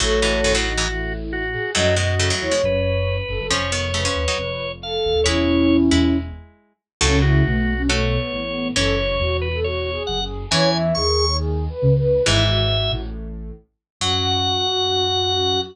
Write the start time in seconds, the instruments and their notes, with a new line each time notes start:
0.00 ocarina A1 A2 A4 C#5, harpsichord A2 F#3, drawbar organ F#4
0.22 harpsichord G#2 E3
0.44 harpsichord F#2 D#3
0.54 harpsichord A2 F#3
0.65 ocarina D#4
0.77 harpsichord G#2 E3
0.88 ocarina E4
1.33 drawbar organ F#4
1.53 ocarina G#4
1.74 ocarina F#2 F#3 D#5, harpsichord A2 F#3, drawbar organ F#4
1.96 harpsichord B2 G#3, drawbar organ F#4, ocarina D#5
2.19 harpsichord C#3 A3
2.30 harpsichord A2 F#3
2.41 ocarina E2 E3 C#5
2.51 harpsichord B2 G#3
2.63 ocarina F#1 F#2, drawbar organ B4
3.28 ocarina F#1 F#2 A4
3.39 ocarina F#1 F#2 A4
3.50 ocarina F1 F2, harpsichord F3 C#4, drawbar organ C#5
3.72 harpsichord D#3 B3
3.94 harpsichord C#3 A3, ocarina B4
4.05 harpsichord F3 C#4
4.15 ocarina D#1 D#2
4.28 harpsichord F#3 D#4
4.38 ocarina F1 F2
4.82 ocarina A4, drawbar organ F5
5.05 ocarina D#1 D#2
5.15 ocarina D#1 D#2
5.24 ocarina E1 E2 C#4 E4, harpsichord G#3 E4, drawbar organ C#5
5.91 ocarina E1 E2, harpsichord G#3 E4
7.01 ocarina C#2 C#3 C#4, harpsichord A2 F#3, drawbar organ A4
7.22 ocarina E4, drawbar organ F#4
7.45 ocarina B1 B2 A3
7.77 ocarina C#4
7.89 ocarina A3, harpsichord A3 F#4, drawbar organ C#5
8.17 ocarina B3
8.32 ocarina A1 A2
8.47 ocarina B3
8.75 ocarina F#1 F#2 A4, harpsichord E3 C#4, drawbar organ C#5
8.98 ocarina C#5
9.20 ocarina E1 E2 F#4
9.41 drawbar organ B4
9.53 ocarina A4
9.63 ocarina F#4, drawbar organ C#5
9.92 ocarina G#4
10.07 ocarina F#1 F#2, drawbar organ F#5
10.21 ocarina G#4
10.51 ocarina E2 E3 C#5, harpsichord E3 C#4, drawbar organ G#5
10.74 ocarina E5
10.95 ocarina D#2 D#3 G#4, drawbar organ C#6
11.28 ocarina C#5
11.38 ocarina G#4
11.69 ocarina B4
11.82 ocarina C#2 C#3
11.98 ocarina B4
12.25 ocarina G#1 G#2 E4, harpsichord G#2 E3, drawbar organ E5
12.48 ocarina F#4
12.91 ocarina A1 A2
14.01 ocarina F#2 F#4, harpsichord F#3, drawbar organ F#5